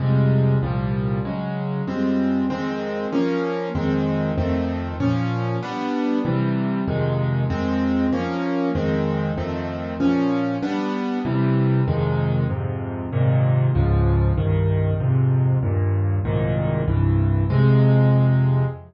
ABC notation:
X:1
M:6/8
L:1/8
Q:3/8=96
K:Fm
V:1 name="Acoustic Grand Piano"
[F,,C,G,A,]3 [C,,B,,F,G,]3 | [D,_G,A,]3 [F,,=G,A,C]3 | [F,,E,A,C]3 [F,B,D]3 | [F,,E,A,C]3 [F,,E,=A,C]3 |
[B,,F,D]3 [G,=B,=D]3 | [C,=E,G,]3 [F,,C,_E,A,]3 | [F,,E,A,C]3 [F,B,D]3 | [F,,E,A,C]3 [F,,E,=A,C]3 |
[B,,F,D]3 [G,=B,=D]3 | [C,=E,G,]3 [F,,C,_E,A,]3 | [F,,A,,C,]3 [A,,B,,C,E,]3 | [D,,A,,F,]3 [C,,G,,E,]3 |
[F,,A,,C,]3 [E,,G,,B,,]3 | [C,,A,,B,,E,]3 [C,,G,,=E,]3 | [F,,C,A,]6 |]